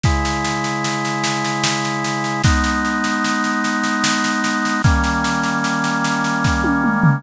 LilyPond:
<<
  \new Staff \with { instrumentName = "Drawbar Organ" } { \time 3/4 \key gis \minor \tempo 4 = 75 <cis gis e'>2. | <gis b dis'>2. | <dis g ais cis'>2. | }
  \new DrumStaff \with { instrumentName = "Drums" } \drummode { \time 3/4 <bd sn>16 sn16 sn16 sn16 sn16 sn16 sn16 sn16 sn16 sn16 sn16 sn16 | <bd sn>16 sn16 sn16 sn16 sn16 sn16 sn16 sn16 sn16 sn16 sn16 sn16 | <bd sn>16 sn16 sn16 sn16 sn16 sn16 sn16 sn16 <bd sn>16 tommh16 toml16 tomfh16 | }
>>